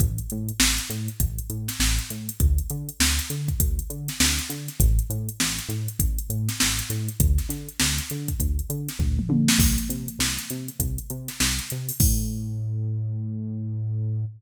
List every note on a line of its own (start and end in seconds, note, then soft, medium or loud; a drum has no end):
0.00 0.20 A1 loud
0.00 kick loud
0.00 closed hi-hat medium
0.18 closed hi-hat medium
0.30 0.51 A2 loud
0.30 closed hi-hat medium
0.48 closed hi-hat medium
0.59 0.79 A1 medium
0.59 snare loud
0.78 closed hi-hat medium
0.90 1.09 A2 loud
0.90 closed hi-hat medium
1.08 closed hi-hat medium
1.20 1.40 A1 medium
1.20 kick medium
1.20 closed hi-hat loud
1.39 closed hi-hat medium
1.50 1.69 A2 medium
1.50 closed hi-hat medium
1.68 snare medium
1.68 closed hi-hat medium
1.79 1.99 A1 medium
1.79 snare medium
1.99 closed hi-hat medium
2.10 2.30 A2 medium
2.10 closed hi-hat medium
2.29 closed hi-hat medium
2.40 2.60 D2 loud
2.40 kick loud
2.40 closed hi-hat medium
2.58 closed hi-hat medium
2.70 2.90 D3 loud
2.70 closed hi-hat medium
2.89 closed hi-hat medium
3.00 3.20 D2 loud
3.00 snare loud
3.19 closed hi-hat medium
3.30 3.50 D3 medium
3.30 closed hi-hat medium
3.48 kick medium
3.48 closed hi-hat medium
3.60 3.80 D2 medium
3.60 kick medium
3.60 closed hi-hat loud
3.79 closed hi-hat medium
3.90 4.09 D3 medium
3.90 closed hi-hat medium
4.08 snare medium
4.08 closed hi-hat medium
4.20 4.40 D2 loud
4.20 snare loud
4.39 snare soft
4.39 closed hi-hat medium
4.50 4.69 D3 loud
4.50 closed hi-hat medium
4.68 snare soft
4.68 closed hi-hat medium
4.80 5.00 A1 loud
4.80 kick medium
4.80 closed hi-hat loud
4.99 closed hi-hat medium
5.10 5.29 A2 loud
5.10 closed hi-hat medium
5.29 closed hi-hat medium
5.40 5.60 A1 loud
5.40 snare medium
5.58 snare soft
5.58 closed hi-hat medium
5.69 5.88 A2 loud
5.69 closed hi-hat medium
5.88 closed hi-hat medium
5.99 6.19 A1 medium
5.99 kick medium
5.99 closed hi-hat loud
6.19 closed hi-hat medium
6.29 6.49 A2 medium
6.29 closed hi-hat medium
6.49 snare medium
6.49 closed hi-hat medium
6.60 6.81 A1 loud
6.60 snare loud
6.79 closed hi-hat medium
6.90 7.09 A2 loud
6.90 snare soft
6.90 closed hi-hat medium
7.08 closed hi-hat medium
7.20 7.39 D2 loud
7.20 kick loud
7.20 closed hi-hat loud
7.38 snare soft
7.38 closed hi-hat medium
7.49 7.69 D3 loud
7.49 snare soft
7.49 closed hi-hat medium
7.69 closed hi-hat medium
7.79 8.00 D2 loud
7.79 snare loud
7.98 closed hi-hat medium
8.10 8.30 D3 medium
8.10 closed hi-hat medium
8.28 kick medium
8.28 closed hi-hat medium
8.40 8.60 D2 medium
8.40 kick medium
8.40 closed hi-hat medium
8.59 closed hi-hat medium
8.70 8.89 D3 loud
8.70 closed hi-hat medium
8.88 snare medium
8.88 closed hi-hat medium
8.99 9.19 D2 loud
8.99 kick medium
8.99 floor tom medium
9.19 mid tom medium
9.29 9.49 D3 loud
9.29 high tom medium
9.48 snare loud
9.58 9.78 C2 loud
9.58 kick loud
9.58 crash loud
9.78 closed hi-hat medium
9.89 10.09 C3 medium
9.89 closed hi-hat medium
10.08 closed hi-hat medium
10.19 10.38 C2 loud
10.19 snare medium
10.38 closed hi-hat medium
10.50 10.70 C3 medium
10.50 closed hi-hat medium
10.68 closed hi-hat medium
10.79 10.99 C2 loud
10.79 kick medium
10.79 closed hi-hat loud
10.98 closed hi-hat medium
11.10 11.30 C3 loud
11.10 closed hi-hat medium
11.28 snare soft
11.28 closed hi-hat medium
11.40 11.60 C2 loud
11.40 snare loud
11.58 snare soft
11.58 closed hi-hat medium
11.70 11.91 C3 loud
11.70 closed hi-hat medium
11.89 open hi-hat medium
12.00 14.25 A2 loud
12.00 kick loud
12.00 crash loud